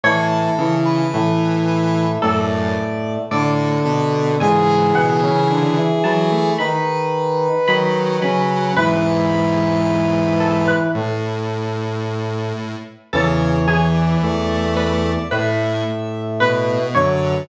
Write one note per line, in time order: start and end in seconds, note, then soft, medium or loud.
0.03 0.48 A2 loud
0.03 0.51 E3 medium
0.03 0.51 E4 medium
0.03 0.75 A4 medium
0.03 1.90 C#5 medium
0.58 1.05 C#3 loud
0.58 1.02 E3 medium
0.58 1.02 E4 medium
0.85 1.56 B4 medium
1.13 2.18 A2 medium
1.13 2.05 E3 medium
1.13 2.18 A3 medium
1.67 2.11 B4 medium
2.22 2.75 F#2 loud
2.22 3.18 A2 medium
2.22 3.18 A3 medium
2.22 3.26 A4 medium
2.22 3.14 D5 medium
3.31 3.78 A2 loud
3.31 4.38 D3 medium
3.31 4.38 D4 medium
3.31 3.82 A4 medium
3.31 4.23 D5 medium
3.84 4.35 B2 loud
3.84 4.36 A4 medium
4.40 4.93 G#2 medium
4.40 5.80 C#3 loud
4.40 5.80 E3 loud
4.40 4.93 G#3 medium
4.40 6.51 G#4 loud
4.40 4.93 G#5 medium
4.95 5.21 B2 medium
4.95 5.21 B3 medium
4.95 5.87 F#5 medium
5.22 5.48 C#3 medium
5.22 5.48 C#4 medium
5.49 5.75 D3 medium
5.49 5.75 D4 medium
5.77 6.02 E3 medium
5.77 6.02 E4 medium
6.04 6.50 E3 medium
6.04 6.30 F#3 loud
6.04 6.50 E4 medium
6.04 6.55 A5 medium
6.32 6.57 A3 loud
6.58 7.48 D#3 medium
6.58 7.48 D#4 medium
6.58 8.72 B4 medium
6.58 7.57 B5 medium
7.67 8.18 D#3 medium
7.67 8.17 F#3 loud
7.67 8.18 D#4 medium
7.67 8.13 B5 medium
8.21 8.72 C#3 medium
8.21 8.74 F#3 loud
8.21 8.72 C#4 medium
8.21 8.66 B5 medium
8.76 10.72 E2 loud
8.76 10.72 G#2 loud
8.76 10.88 E3 medium
8.76 10.88 E4 medium
8.76 10.79 B4 loud
8.76 10.15 B4 medium
10.40 10.66 A4 medium
10.67 11.83 B4 medium
10.95 12.75 A2 medium
10.95 12.53 A2 medium
10.95 12.53 A3 medium
13.13 14.17 E2 medium
13.13 13.59 C#3 loud
13.13 14.17 E3 medium
13.13 13.62 A4 medium
13.13 13.87 C#5 medium
13.67 14.21 E3 loud
13.67 14.73 G#4 medium
13.94 14.74 D5 medium
14.22 15.18 E2 medium
14.22 15.18 E3 medium
14.22 15.11 A3 loud
14.76 15.22 B4 medium
14.76 15.26 D5 medium
15.30 16.79 A2 medium
15.30 15.83 A2 loud
15.30 16.79 A3 medium
15.30 16.28 B4 medium
15.30 16.20 E5 medium
16.40 16.94 B2 medium
16.40 16.86 B4 medium
16.40 16.92 B4 medium
16.95 17.43 F#2 medium
16.95 17.42 D3 loud
16.95 17.43 F#3 medium
16.95 17.45 C#5 medium
16.95 17.44 C#5 medium